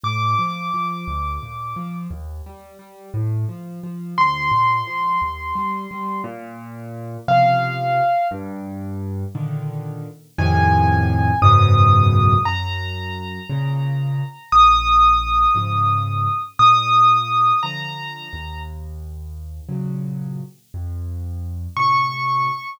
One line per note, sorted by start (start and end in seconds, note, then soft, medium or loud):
0.04 0.35 A2 medium
0.04 1.97 D6 medium
0.39 0.70 F3 medium
0.74 1.05 F3 medium
1.07 1.39 D2 medium
1.43 1.74 A#2 medium
1.76 2.07 F3 medium
2.11 2.42 D#2 medium
2.46 2.77 G3 medium
2.79 3.10 G3 medium
3.14 3.45 A2 loud
3.49 3.80 F3 medium
3.83 4.15 F3 medium
4.18 4.49 D2 medium
4.18 6.21 C6 medium
4.52 4.83 A#2 medium
4.87 5.18 F3 medium
5.22 5.53 D#2 medium
5.55 5.86 G3 medium
5.91 6.22 G3 medium
6.24 7.17 A#2 loud
7.28 8.01 C3 medium
7.28 8.01 C#3 medium
7.28 8.01 F3 medium
7.28 8.28 F5 medium
8.31 9.24 G2 loud
9.35 10.07 A#2 medium
9.35 10.07 D3 medium
9.35 10.07 D#3 medium
10.39 11.32 F2 loud
10.39 11.32 A2 loud
10.39 11.32 C3 loud
10.39 11.32 D#3 loud
10.39 11.40 G#5 medium
11.42 12.35 C#2 loud
11.42 12.35 F#2 loud
11.42 12.35 G#2 loud
11.42 12.35 B2 loud
11.42 12.42 D#6 medium
12.45 13.39 F#2 loud
12.45 14.50 A#5 medium
13.50 14.22 A#2 medium
13.50 14.22 C#3 loud
14.52 15.46 A#1 medium
14.52 16.42 D#6 medium
15.55 16.27 G#2 medium
15.55 16.27 C#3 medium
15.55 16.27 F3 medium
16.59 17.53 A#2 medium
16.59 17.60 D#6 medium
17.63 18.28 D3 medium
17.63 18.28 F3 medium
17.63 18.60 A#5 medium
18.33 19.61 D#2 medium
19.69 20.41 A#2 medium
19.69 20.41 C#3 medium
19.69 20.41 F#3 medium
20.74 21.67 F2 medium
21.77 22.49 A2 medium
21.77 22.49 C3 medium
21.77 22.70 C#6 medium